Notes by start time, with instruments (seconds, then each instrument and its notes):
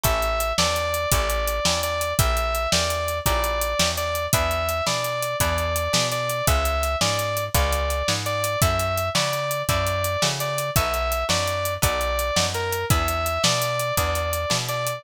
0.03 electric bass (finger) A1, acoustic guitar (steel) C#4 E4 G4 A4, distortion guitar E5, kick, closed hi-hat
0.22 closed hi-hat
0.40 closed hi-hat
0.58 electric bass (finger) E2, acoustic guitar (steel) C#4 E4 G4 A4, distortion guitar D5, snare
0.76 closed hi-hat
0.94 closed hi-hat
1.12 electric bass (finger) A1, acoustic guitar (steel) C#4 E4 G4 A4, distortion guitar D5, kick, closed hi-hat
1.30 closed hi-hat
1.47 closed hi-hat
1.65 electric bass (finger) E2, acoustic guitar (steel) C#4 E4 G4 A4, snare
1.83 distortion guitar D5, closed hi-hat
2.01 closed hi-hat
2.19 electric bass (finger) A#1, acoustic guitar (steel) C#4 E4 G4 A#4, distortion guitar E5, kick, closed hi-hat
2.37 closed hi-hat
2.55 closed hi-hat
2.72 electric bass (finger) E2, acoustic guitar (steel) C#4 E4 G4 A#4, distortion guitar D5, snare
2.90 closed hi-hat
3.08 closed hi-hat
3.26 electric bass (finger) A#1, acoustic guitar (steel) C#4 E4 G4 A#4, distortion guitar D5, kick, closed hi-hat
3.44 closed hi-hat
3.61 closed hi-hat
3.79 electric bass (finger) E2, acoustic guitar (steel) C#4 E4 G4 A#4, snare, closed hi-hat
3.97 distortion guitar D5, closed hi-hat
4.15 closed hi-hat
4.33 electric bass (finger) E2, acoustic guitar (steel) D4 E4 G#4 B4, distortion guitar E5, kick, closed hi-hat
4.51 closed hi-hat
4.69 closed hi-hat
4.86 electric bass (finger) B2, acoustic guitar (steel) D4 E4 G#4 B4, distortion guitar D5, snare
5.04 closed hi-hat
5.22 closed hi-hat
5.40 electric bass (finger) E2, acoustic guitar (steel) D4 E4 G#4 B4, distortion guitar D5, kick, closed hi-hat
5.58 closed hi-hat
5.76 closed hi-hat
5.93 electric bass (finger) B2, acoustic guitar (steel) D4 E4 G#4 B4, snare
6.12 distortion guitar D5, closed hi-hat
6.29 closed hi-hat
6.47 electric bass (finger) C#2, acoustic guitar (steel) C#4 F4 G#4 B4, distortion guitar E5, kick, closed hi-hat
6.65 closed hi-hat
6.83 closed hi-hat
7.01 electric bass (finger) G#2, acoustic guitar (steel) C#4 F4 G#4 B4, distortion guitar D5, snare
7.19 closed hi-hat
7.37 closed hi-hat
7.54 electric bass (finger) C#2, acoustic guitar (steel) C#4 F4 G#4 B4, distortion guitar D5, kick, closed hi-hat
7.72 closed hi-hat
7.90 closed hi-hat
8.08 electric bass (finger) G#2, acoustic guitar (steel) C#4 F4 G#4 B4, snare
8.26 distortion guitar D5, closed hi-hat
8.44 closed hi-hat
8.62 electric bass (finger) F#2, acoustic guitar (steel) C#4 E4 F#4 A4, distortion guitar E5, kick, closed hi-hat
8.79 closed hi-hat
8.97 closed hi-hat
9.15 electric bass (finger) C#3, acoustic guitar (steel) C#4 E4 F#4 A4, distortion guitar D5, snare
9.33 closed hi-hat
9.51 closed hi-hat
9.69 electric bass (finger) F#2, acoustic guitar (steel) C#4 E4 F#4 A4, distortion guitar D5, kick, closed hi-hat
9.87 closed hi-hat
10.04 closed hi-hat
10.22 electric bass (finger) C#3, acoustic guitar (steel) C#4 E4 F#4 A4, snare
10.40 distortion guitar D5, closed hi-hat
10.58 closed hi-hat
10.76 electric bass (finger) B1, acoustic guitar (steel) B3 D#4 F#4 A4, distortion guitar E5, kick, closed hi-hat
10.94 closed hi-hat
11.12 closed hi-hat
11.29 electric bass (finger) F#2, acoustic guitar (steel) B3 D#4 F#4 A4, distortion guitar D5, snare
11.47 closed hi-hat
11.65 closed hi-hat
11.82 electric bass (finger) B1, acoustic guitar (steel) B3 D#4 F#4 A4, distortion guitar D5, kick, closed hi-hat
12.01 closed hi-hat
12.19 closed hi-hat
12.36 electric bass (finger) F#2, acoustic guitar (steel) B3 D#4 F#4 A4, snare
12.54 distortion guitar A#4, closed hi-hat
12.72 closed hi-hat
12.90 electric bass (finger) E2, acoustic guitar (steel) B3 D4 E4 G#4, distortion guitar E5, kick, closed hi-hat
13.08 closed hi-hat
13.26 closed hi-hat
13.44 electric bass (finger) B2, acoustic guitar (steel) B3 D4 E4 G#4, distortion guitar D5, snare
13.62 closed hi-hat
13.79 closed hi-hat
13.97 electric bass (finger) E2, acoustic guitar (steel) B3 D4 E4 G#4, distortion guitar D5, kick, closed hi-hat
14.15 closed hi-hat
14.33 closed hi-hat
14.50 electric bass (finger) B2, acoustic guitar (steel) B3 D4 E4 G#4, snare
14.69 distortion guitar D5, closed hi-hat
14.87 closed hi-hat